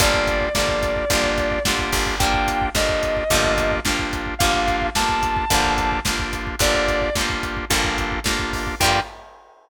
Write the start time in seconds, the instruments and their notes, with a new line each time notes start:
0.00 electric bass (finger) G1, acoustic guitar (steel) D3 F3 G3, drawbar organ A#3 D4 F4 G4, distortion guitar D5, kick, closed hi-hat
0.05 acoustic guitar (steel) A#3
0.14 kick
0.27 kick, closed hi-hat
0.41 kick
0.55 electric bass (finger) G1, acoustic guitar (steel) D3 F3, drawbar organ A#3 D4 F4 G4, distortion guitar D5, kick, snare
0.59 acoustic guitar (steel) G3 A#3
0.68 kick
0.83 kick, closed hi-hat
0.96 kick
1.10 electric bass (finger) G1, acoustic guitar (steel) D3 F3 G3, drawbar organ A#3 D4 F4 G4, kick, closed hi-hat
1.15 acoustic guitar (steel) A#3
1.24 kick
1.38 kick, closed hi-hat
1.51 kick
1.65 electric bass (finger) G1, acoustic guitar (steel) D3 F3, drawbar organ A#3 D4 F4 G4, kick, snare
1.69 acoustic guitar (steel) G3 A#3
1.79 kick
1.92 electric bass (finger) G1, kick, open hi-hat
2.07 kick
2.19 acoustic guitar (steel) D3 F3 G3, drawbar organ A#3 D4 F4 G4, distortion guitar G5, kick, closed hi-hat
2.24 acoustic guitar (steel) A#3
2.34 kick
2.47 kick, closed hi-hat
2.62 kick
2.74 electric bass (finger) G1, acoustic guitar (steel) D3 F3 G3, drawbar organ A#3 D4 F4 G4, distortion guitar D#5, kick, snare
2.79 acoustic guitar (steel) A#3
2.89 kick
3.03 kick, closed hi-hat
3.17 kick
3.30 electric bass (finger) G1, acoustic guitar (steel) D3 F3 G3, drawbar organ A#3 D4 F4 G4, kick, closed hi-hat
3.35 acoustic guitar (steel) A#3
3.44 kick
3.58 kick, closed hi-hat
3.72 kick
3.85 electric bass (finger) G1, acoustic guitar (steel) D3 F3 G3, drawbar organ A#3 D4 F4 G4, kick, snare
3.89 acoustic guitar (steel) A#3
3.99 kick
4.13 kick, closed hi-hat
4.26 kick
4.39 electric bass (finger) G1, acoustic guitar (steel) D3 F3, drawbar organ A#3 D4 F4 G4, distortion guitar F5, kick, closed hi-hat
4.43 acoustic guitar (steel) G3 A#3
4.54 kick
4.68 kick, closed hi-hat
4.82 kick
4.95 electric bass (finger) G1, acoustic guitar (steel) D3 F3 G3, drawbar organ A#3 D4 F4 G4, distortion guitar A5, kick, snare
4.99 acoustic guitar (steel) A#3
5.09 kick
5.23 kick, closed hi-hat
5.37 kick
5.50 electric bass (finger) G1, acoustic guitar (steel) D3 F3 G3, drawbar organ A#3 D4 F4 G4, kick, closed hi-hat
5.55 acoustic guitar (steel) A#3
5.64 kick
5.78 kick, closed hi-hat
5.92 kick
6.05 electric bass (finger) G1, acoustic guitar (steel) D3 F3 G3, drawbar organ A#3 D4 F4 G4, kick, snare
6.09 acoustic guitar (steel) A#3
6.19 kick
6.33 kick, closed hi-hat
6.47 kick
6.59 electric bass (finger) G1, acoustic guitar (steel) D3 F3 G3, drawbar organ A#3 D4 F4 G4, distortion guitar D5, kick, closed hi-hat
6.64 acoustic guitar (steel) A#3
6.74 kick
6.88 kick, closed hi-hat
7.02 kick
7.15 electric bass (finger) G1, acoustic guitar (steel) D3 F3, drawbar organ A#3 D4 F4 G4, kick, snare
7.19 acoustic guitar (steel) G3 A#3
7.30 kick
7.43 kick, closed hi-hat
7.57 kick
7.70 electric bass (finger) G1, acoustic guitar (steel) D3 F3 G3, drawbar organ A#3 D4 F4 G4, kick, closed hi-hat
7.75 acoustic guitar (steel) A#3
7.84 kick
7.98 kick, closed hi-hat
8.12 kick
8.24 electric bass (finger) G1, acoustic guitar (steel) D3 F3 G3, drawbar organ A#3 D4 F4 G4, kick, snare
8.28 acoustic guitar (steel) A#3
8.39 kick
8.53 kick, open hi-hat
8.67 kick
8.80 electric bass (finger) G2, acoustic guitar (steel) D3 F3, drawbar organ A#3 D4 F4 G4, distortion guitar G5, kick, crash
8.84 acoustic guitar (steel) G3 A#3